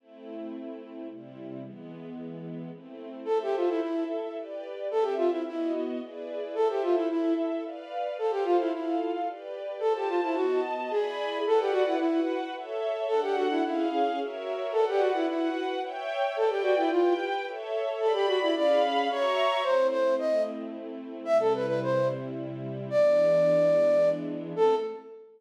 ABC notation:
X:1
M:3/4
L:1/16
Q:1/4=110
K:Am
V:1 name="Flute"
z12 | z12 | A G F E E2 z6 | A G F E E2 z6 |
A G F E E2 z6 | A G F E E2 z6 | A G F E ^F2 z2 ^G4 | [K:Bm] A G F E E2 z6 |
A G F E E2 z6 | A G F E E2 z6 | A G F E =F2 z6 | A G F E d2 z2 c4 |
[K:Am] c2 c2 ^d2 z6 | e A B B c2 z6 | d10 z2 | A4 z8 |]
V:2 name="String Ensemble 1"
[A,CE]8 [C,G,E]4 | [E,^G,B,]8 [A,CE]4 | [Ace]4 [EAe]4 [GBd]4 | [CGe]4 [B,^F^d]4 [E^GB=d]4 |
[Ace]4 [EAe]4 [Bdf]4 | [Acf]4 [FAf]4 [GBd]4 | [Fca]4 [B,^F^da]4 [E=d^gb]4 | [K:Bm] [Bdf]4 [FBf]4 [Ace]4 |
[DAf]4 [C^G^e]4 [F^Ac=e]4 | [Bdf]4 [FBf]4 [ceg]4 | [Bdg]4 [GBg]4 [Ace]4 | [Gdb]4 [C^G^eb]4 [F=e^ac']4 |
[K:Am] [A,CE]12 | [C,G,E]12 | [E,^G,B,D]12 | [A,CE]4 z8 |]